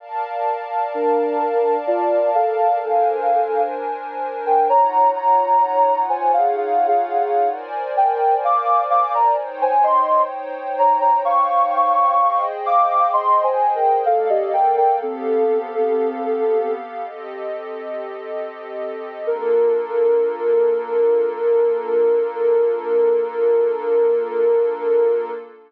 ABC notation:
X:1
M:5/4
L:1/16
Q:1/4=64
K:Bbmix
V:1 name="Ocarina"
z4 [DB]4 [Fd]2 [=Af]6 z3 [Bg] | [_db]2 [db]4 [ca] [Af] (3[Af]2 [Af]2 [Af]2 z2 [Bg]2 [f=d']2 [fd'] [=db] | z [ca] [ec']2 z2 [_db] [db] [f_d']6 [f=d']2 (3[ec']2 [ca]2 [Bg]2 | "^rit." [=Af] [Ge] [Bg] [Bg] [CA]8 z8 |
B20 |]
V:2 name="Pad 2 (warm)"
[Bdf=a]12 [DBc_a]8 | [EF_d_g]12 [Bc=da]8 | [Ec_dg]12 [Aceg]8 | "^rit." [B,=Adf]4 [=B,GAf]8 [CGAe]8 |
[B,DF=A]20 |]